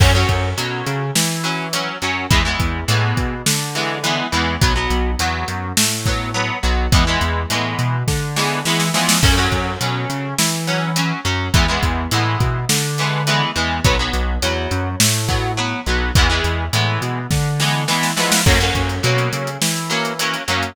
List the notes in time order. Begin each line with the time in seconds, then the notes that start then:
0.00 F#2 F#3 C#4, kick, crash
0.15 F#3 C#4
0.29 F#2, kick, closed hi-hat
0.57 B2 F#3 C#4, closed hi-hat
0.86 C#3, closed hi-hat
1.15 E3, snare
1.44 F#3 C#4, closed hi-hat
1.73 F#3 C#4, closed hi-hat
2.02 F#2 F#3 C#4, closed hi-hat
2.31 E2 E3 G#3 B3, kick, closed hi-hat
2.45 E3 G#3 B3
2.60 E2, kick, closed hi-hat
2.88 A2 E3 G#3 B3, closed hi-hat
3.17 B2, kick, closed hi-hat
3.46 D3, snare
3.75 E3 G#3 B3, closed hi-hat
4.04 E3 G#3 B3, closed hi-hat
4.32 E2 E3 G#3 B3, closed hi-hat
4.61 B1 F#3 B3, kick, closed hi-hat
4.76 F#3 B3
4.90 B1, closed hi-hat
5.19 E2 F#3 B3, closed hi-hat
5.48 F#2, closed hi-hat
5.77 A2, snare
6.06 F#3 B3, kick, closed hi-hat
6.34 F#3 B3
6.63 B1 F#3 B3, closed hi-hat
6.92 E2 E3 G#3 B3, kick, closed hi-hat
7.07 E3 G#3 B3
7.21 E2, closed hi-hat
7.50 A2 E3 G#3 B3, closed hi-hat
7.79 B2, closed hi-hat
8.08 D3, kick, snare
8.36 E3 G#3 B3, snare
8.65 E3 G#3 B3, snare
8.80 snare
8.94 E3 F3 G#3 B3, snare
9.09 snare
9.22 F#2 F#3 C#4, kick, crash
9.37 F#3 C#4
9.52 F#2, kick, closed hi-hat
9.81 B2 F#3 C#4, closed hi-hat
10.09 C#3, closed hi-hat
10.38 E3, snare
10.67 F#3 C#4, closed hi-hat
10.96 F#3 C#4, closed hi-hat
11.25 F#2 F#3 C#4, closed hi-hat
11.54 E2 E3 G#3 B3, kick, closed hi-hat
11.68 E3 G#3 B3
11.83 E2, kick, closed hi-hat
12.11 A2 E3 G#3 B3, closed hi-hat
12.40 B2, kick, closed hi-hat
12.69 D3, snare
12.98 E3 G#3 B3, closed hi-hat
13.27 E3 G#3 B3, closed hi-hat
13.56 E2 E3 G#3 B3, closed hi-hat
13.84 B1 F#3 B3, kick, closed hi-hat
13.99 F#3 B3
14.13 B1, closed hi-hat
14.42 E2 F#3 B3, closed hi-hat
14.71 F#2, closed hi-hat
15.00 A2, snare
15.28 F#3 B3, kick, closed hi-hat
15.57 F#3 B3
15.86 B1 F#3 B3, closed hi-hat
16.15 E2 E3 G#3 B3, kick, closed hi-hat
16.30 E3 G#3 B3
16.44 E2, closed hi-hat
16.73 A2 E3 G#3 B3, closed hi-hat
17.02 B2, closed hi-hat
17.31 D3, kick, snare
17.60 E3 G#3 B3, snare
17.88 E3 G#3 B3, snare
18.03 snare
18.17 E3 F3 G#3 B3, snare
18.32 snare
18.46 F#2 F#3 A#3 C#4, kick, crash
18.60 F#3 A#3 C#4, closed hi-hat
18.75 F#2, kick, closed hi-hat
18.89 closed hi-hat
19.03 B2 F#3 A#3 C#4, closed hi-hat
19.18 closed hi-hat
19.33 C#3, closed hi-hat
19.47 closed hi-hat
19.62 E3, snare
19.76 closed hi-hat
19.90 F#3 A#3 C#4, closed hi-hat
20.05 closed hi-hat
20.19 F#3 A#3 C#4, closed hi-hat
20.34 closed hi-hat
20.48 F#2 F#3 A#3 C#4, closed hi-hat
20.63 closed hi-hat